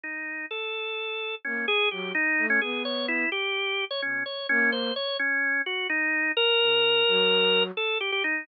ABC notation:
X:1
M:9/8
L:1/16
Q:3/8=85
K:none
V:1 name="Flute"
z12 _B,2 z2 _G,2 | z2 A,2 B,6 z6 B,,2 | z2 _B,4 z12 | z2 _D,4 _G,6 z6 |]
V:2 name="Drawbar Organ"
_E4 A8 _D2 _A2 G2 | _E3 _D _A2 _d2 =E2 G5 d D2 | _d2 _D2 c2 d2 D4 _G2 _E4 | _B12 A2 G G _E2 |]